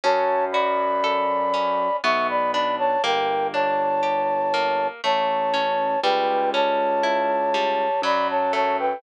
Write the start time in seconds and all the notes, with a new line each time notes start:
0.04 F#2 C#4 C#5 A5
0.52 F#4 D5 B5
1.04 A4
1.54 C#4
2.04 B1 B3 E5 C#6
2.29 D5 B5
2.52 D4 D5 B5
2.79 C#5 A5
3.03 G1 A#3 A#4 G5
3.54 D4 C#5 A5
4.03 G4
4.54 A#3
5.04 A1 A3 C#5 A5
5.54 C#4
6.03 C#2 G3 B4 G5
6.54 C#4 C#5 A5
7.03 E4
7.54 G3
8.02 F#2 F#3 D5 B5
8.30 C#5 A5
8.53 A3 C#5 A5
8.79 B4 G5